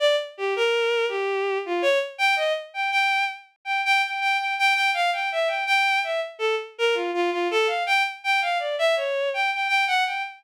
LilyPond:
\new Staff { \time 7/8 \tempo 4 = 82 d''16 r16 g'16 bes'8. g'8. f'16 des''16 r16 g''16 ees''16 | r16 g''16 g''8 r8 g''16 g''16 g''16 g''16 g''16 g''16 g''16 f''16 | g''16 e''16 g''16 g''8 e''16 r16 a'16 r16 bes'16 f'16 f'16 f'16 a'16 | f''16 g''16 r16 g''16 f''16 d''16 e''16 des''8 g''16 g''16 g''16 ges''16 g''16 | }